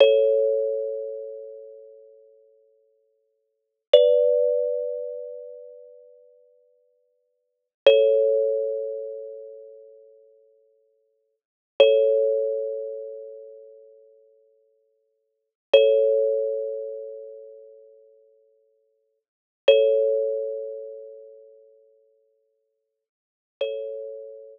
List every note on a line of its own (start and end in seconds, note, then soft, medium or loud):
0.00 3.82 A4 medium
0.00 3.82 C#5 medium
3.93 7.67 B4 medium
3.93 7.67 D5 medium
7.86 11.35 A4 medium
7.86 11.35 C#5 medium
11.80 15.49 A4 medium
11.80 15.49 C#5 medium
15.74 19.19 A4 medium
15.74 19.19 C#5 medium
19.68 23.04 A4 medium
19.68 23.04 C#5 medium
23.61 24.59 A4 medium
23.61 24.59 C#5 medium